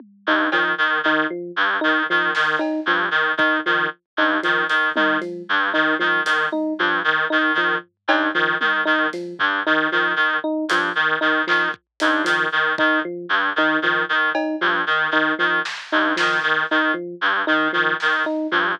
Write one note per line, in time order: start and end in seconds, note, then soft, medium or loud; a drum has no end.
0.00 high tom medium
0.27 0.47 G2 medium
0.27 0.49 D#4 medium
0.52 0.72 D#3 medium
0.52 0.74 F3 medium
0.52 cowbell medium
0.78 0.99 D#3 medium
1.03 1.24 D#3 medium
1.03 1.27 D#4 medium
1.30 1.51 F3 medium
1.56 1.77 G2 medium
1.81 2.04 D#3 medium
1.81 2.02 D#4 medium
2.10 2.31 D#3 medium
2.10 2.31 F3 medium
2.35 2.56 D#3 medium
2.35 snare medium
2.59 2.80 D#4 medium
2.59 cowbell medium
2.86 3.07 G2 medium
2.86 3.08 F3 medium
3.11 3.32 D#3 medium
3.37 3.58 D#3 medium
3.37 3.59 D#4 medium
3.37 kick loud
3.66 3.87 D#3 medium
3.66 3.87 F3 medium
4.17 4.38 G2 medium
4.17 4.39 D#4 medium
4.43 4.65 D#3 medium
4.43 4.64 F3 medium
4.43 closed hi-hat medium
4.69 4.90 D#3 medium
4.69 closed hi-hat medium
4.96 5.17 D#3 medium
4.96 5.17 D#4 medium
4.96 high tom loud
5.21 5.42 F3 medium
5.21 closed hi-hat medium
5.49 5.70 G2 medium
5.74 5.95 D#3 medium
5.74 5.95 D#4 medium
5.99 6.21 D#3 medium
5.99 6.20 F3 medium
5.99 high tom medium
6.25 6.46 D#3 medium
6.25 closed hi-hat loud
6.52 6.73 D#4 medium
6.52 high tom medium
6.79 7.00 G2 medium
6.79 7.01 F3 medium
7.04 7.25 D#3 medium
7.30 7.53 D#3 medium
7.30 7.51 D#4 medium
7.55 7.75 D#3 medium
7.55 7.78 F3 medium
7.55 floor tom medium
8.08 8.28 G2 medium
8.08 8.30 D#4 medium
8.08 cowbell loud
8.34 8.55 D#3 medium
8.34 8.56 F3 medium
8.61 8.81 D#3 medium
8.61 high tom medium
8.85 9.07 D#3 medium
8.85 9.06 D#4 medium
9.13 9.34 F3 medium
9.13 closed hi-hat medium
9.39 9.60 G2 medium
9.39 floor tom loud
9.67 9.87 D#3 medium
9.67 9.87 D#4 medium
9.92 10.13 D#3 medium
9.92 10.13 F3 medium
10.16 10.37 D#3 medium
10.44 10.65 D#4 medium
10.69 10.90 G2 medium
10.69 10.92 F3 medium
10.69 closed hi-hat loud
10.95 11.16 D#3 medium
11.21 11.42 D#3 medium
11.21 11.42 D#4 medium
11.47 11.69 D#3 medium
11.47 11.68 F3 medium
11.47 clap medium
11.74 kick medium
12.00 12.22 G2 medium
12.00 12.22 D#4 medium
12.00 closed hi-hat loud
12.24 12.47 D#3 medium
12.24 12.45 F3 medium
12.24 closed hi-hat loud
12.52 12.73 D#3 medium
12.78 13.00 D#3 medium
12.78 12.99 D#4 medium
12.78 kick loud
13.05 13.26 F3 medium
13.29 13.50 G2 medium
13.56 13.77 D#3 medium
13.56 13.79 D#4 medium
13.82 14.03 D#3 medium
13.82 14.04 F3 medium
13.82 floor tom medium
14.09 14.30 D#3 medium
14.35 14.56 D#4 medium
14.35 cowbell loud
14.61 14.82 G2 medium
14.61 14.82 F3 medium
14.87 15.07 D#3 medium
15.11 15.32 D#3 medium
15.11 15.34 D#4 medium
15.39 15.60 D#3 medium
15.39 15.59 F3 medium
15.65 snare medium
15.92 16.13 G2 medium
15.92 16.13 D#4 medium
16.16 16.40 D#3 medium
16.16 16.37 F3 medium
16.16 snare medium
16.43 16.64 D#3 medium
16.71 16.92 D#3 medium
16.71 16.92 D#4 medium
16.94 17.15 F3 medium
17.21 17.42 G2 medium
17.47 17.68 D#3 medium
17.47 17.68 D#4 medium
17.73 17.94 D#3 medium
17.73 17.94 F3 medium
18.00 18.23 D#3 medium
18.00 snare medium
18.26 18.47 D#4 medium
18.51 18.72 G2 medium
18.51 18.73 F3 medium
18.51 floor tom medium